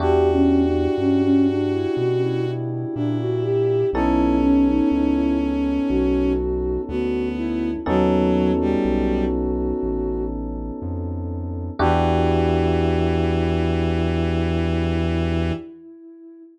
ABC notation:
X:1
M:4/4
L:1/16
Q:1/4=61
K:Edor
V:1 name="Ocarina"
(3G2 C2 D2 C C D E F E E E D F G2 | E2 C ^D D E z2 F4 F2 E2 | F12 z4 | E16 |]
V:2 name="Violin"
F12 E4 | C12 B,4 | F,3 G,3 z10 | E,16 |]
V:3 name="Electric Piano 1"
[DEFG]16 | [B,C^DA]16 | [B,C^DA]16 | [DEFG]16 |]
V:4 name="Synth Bass 1" clef=bass
E,,4 G,,4 B,,4 ^A,,4 | B,,,4 C,,4 B,,,4 D,,4 | ^D,,4 B,,,4 A,,,4 =F,,4 | E,,16 |]